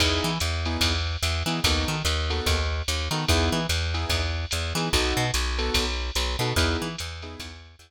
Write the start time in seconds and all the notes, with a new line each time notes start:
0.00 E2 B3 D#4 E4 G#4, kick, crash, ride
0.24 E3
0.40 E2, hi-hat pedal, ride
0.65 B3 D#4 E4 G#4, ride
0.81 E2, kick, ride
1.23 E2, hi-hat pedal, ride
1.46 E3 B3 D#4 E4 G#4, ride
1.64 D#2 B3 D#4 F#4 A4, kick, ride
1.88 D#3
2.05 D#2, hi-hat pedal, ride
2.30 B3 D#4 F#4 A4, ride
2.46 D#2, kick, ride
2.88 D#2, hi-hat pedal, ride
3.11 D#3 B3 D#4 F#4 A4, ride
3.29 E2 B3 D#4 E4 G#4, kick, ride
3.52 E3
3.69 E2, hi-hat pedal, ride
3.94 B3 D#4 E4 G#4, ride
4.10 E2, kick, ride
4.51 E2, hi-hat pedal, ride
4.75 E3 B3 D#4 E4 G#4, ride
4.93 B1 B3 D#4 F#4 A4, kick, ride
5.17 B2
5.34 B1, hi-hat pedal, ride
5.59 B3 D#4 F#4 A4, ride
5.74 B1, kick, ride
6.15 B1, hi-hat pedal, ride
6.39 B2 B3 D#4 F#4 A4, ride
6.56 E2 B3 D#4 E4 G#4, kick, ride
6.82 E3
6.98 E2, hi-hat pedal, ride
7.22 B3 D#4 E4 G#4, ride
7.40 E2, kick, ride
7.79 E2, hi-hat pedal, ride